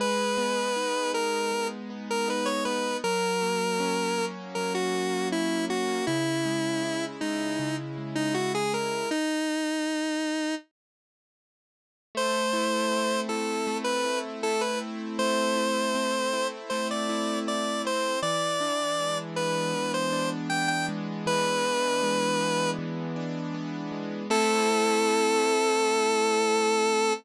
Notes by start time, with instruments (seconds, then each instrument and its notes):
0.00 acoustic grand piano G#3, lead 1 (square) B4
0.38 acoustic grand piano B3
0.76 acoustic grand piano D#4
1.13 acoustic grand piano B3, lead 1 (square) A#4
1.52 acoustic grand piano G#3
1.90 acoustic grand piano B3
2.10 lead 1 (square) A#4
2.28 acoustic grand piano D#4, lead 1 (square) B4
2.46 lead 1 (square) C#5
2.65 acoustic grand piano B3, lead 1 (square) B4
3.04 acoustic grand piano F#3, lead 1 (square) A#4
3.42 acoustic grand piano A#3
3.80 acoustic grand piano C#4
4.18 acoustic grand piano A#3
4.55 acoustic grand piano F#3, lead 1 (square) A#4
4.75 lead 1 (square) F#4
4.94 acoustic grand piano A#3
5.32 acoustic grand piano C#4, lead 1 (square) E4
5.70 acoustic grand piano A#3, lead 1 (square) F#4
6.07 acoustic grand piano C#3, lead 1 (square) E4
6.46 acoustic grand piano G#3
6.83 acoustic grand piano E4
7.21 acoustic grand piano G#3, lead 1 (square) D#4
7.59 acoustic grand piano C#3
7.98 acoustic grand piano G#3
8.15 lead 1 (square) D#4
8.34 acoustic grand piano E4, lead 1 (square) F#4
8.55 lead 1 (square) G#4
8.73 acoustic grand piano G#3, lead 1 (square) A#4
9.11 lead 1 (square) D#4
12.15 acoustic grand piano A3, lead 1 (square) C5
12.53 acoustic grand piano E4
12.92 acoustic grand piano C4
13.29 acoustic grand piano E4, lead 1 (square) A4
13.67 acoustic grand piano A3
13.84 lead 1 (square) B4
14.05 acoustic grand piano E4
14.43 acoustic grand piano E4, lead 1 (square) A4
14.61 lead 1 (square) B4
14.81 acoustic grand piano C4
15.19 acoustic grand piano A3, lead 1 (square) C5
15.56 acoustic grand piano E4
15.95 acoustic grand piano C4
16.33 acoustic grand piano E4
16.70 acoustic grand piano A3, lead 1 (square) C5
16.91 lead 1 (square) D5
17.09 acoustic grand piano E4
17.47 acoustic grand piano E4, lead 1 (square) D5
17.85 acoustic grand piano C4, lead 1 (square) C5
18.22 acoustic grand piano E3, lead 1 (square) D5
18.60 acoustic grand piano D4
18.99 acoustic grand piano G#3
19.36 acoustic grand piano B3, lead 1 (square) B4
19.74 acoustic grand piano E3
19.94 lead 1 (square) C5
20.13 acoustic grand piano D4
20.50 acoustic grand piano B3, lead 1 (square) G5
20.68 lead 1 (square) G5
20.89 acoustic grand piano G#3
21.26 acoustic grand piano E3, lead 1 (square) B4
21.65 acoustic grand piano D4
22.03 acoustic grand piano G#3
22.40 acoustic grand piano B3
22.79 acoustic grand piano E3
23.16 acoustic grand piano D4
23.54 acoustic grand piano B3
23.92 acoustic grand piano G#3
24.30 acoustic grand piano A3 C4 E4, lead 1 (square) A4